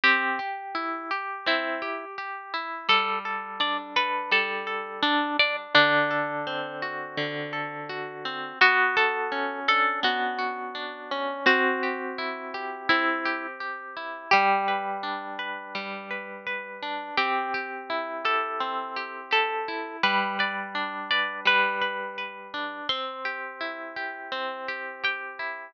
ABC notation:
X:1
M:4/4
L:1/16
Q:1/4=84
K:G
V:1 name="Orchestral Harp"
G8 E4 z4 | A2 z2 d z B2 A4 D2 d z | D8 z8 | F2 A4 A2 F8 |
F8 E4 z4 | G16 | G6 A6 A4 | B2 d4 d2 B8 |
c'12 g4 |]
V:2 name="Orchestral Harp"
C2 G2 E2 G2 C2 G2 G2 E2 | G,2 A2 D2 A2 G,2 A2 A2 D2 | D,2 A2 C2 F2 D,2 A2 F2 C2 | B,2 F2 ^C2 D2 B,2 F2 D2 C2 |
C2 G2 E2 G2 C2 G2 G2 E2 | G,2 B2 D2 B2 G,2 B2 B2 D2 | C2 G2 E2 G2 C2 G2 G2 E2 | G,2 B2 D2 B2 G,2 B2 B2 D2 |
C2 G2 E2 G2 C2 G2 G2 E2 |]